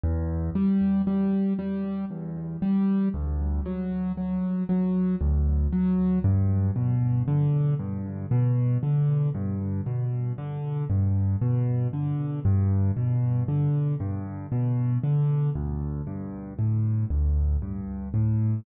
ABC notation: X:1
M:3/4
L:1/8
Q:1/4=58
K:Em
V:1 name="Acoustic Grand Piano" clef=bass
E,, G, G, G, E,, G, | D,, F, F, F, D,, F, | G,, B,, D, G,, B,, D, | G,, B,, D, G,, B,, D, |
[K:G] G,, B,, D, G,, B,, D, | D,, G,, A,, D,, G,, A,, |]